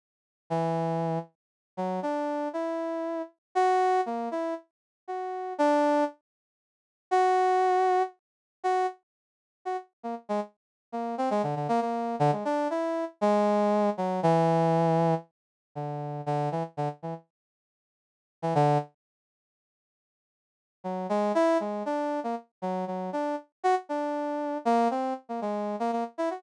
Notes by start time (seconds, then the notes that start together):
0.50 E3
1.77 F#3
2.03 D4
2.53 E4
3.55 F#4
4.06 A#3
4.31 E4
5.08 F#4
5.58 D4
7.11 F#4
8.64 F#4
9.65 F#4
10.03 A#3
10.29 G#3
10.92 A#3
11.18 C4
11.31 G#3
11.43 D3
11.56 D3
11.69 A#3
11.81 A#3
12.19 D3
12.32 G#3
12.45 D4
12.70 E4
13.21 G#3
13.97 F#3
14.23 E3
15.75 D3
16.26 D3
16.52 E3
16.77 D3
17.03 E3
18.42 E3
18.55 D3
20.84 F#3
21.09 G#3
21.35 E4
21.60 G#3
21.86 D4
22.24 A#3
22.62 F#3
22.87 F#3
23.13 D4
23.64 F#4
23.89 D4
24.65 A#3
24.91 C4
25.29 A#3
25.42 G#3
25.80 A#3
25.92 A#3
26.18 E4
26.31 F#4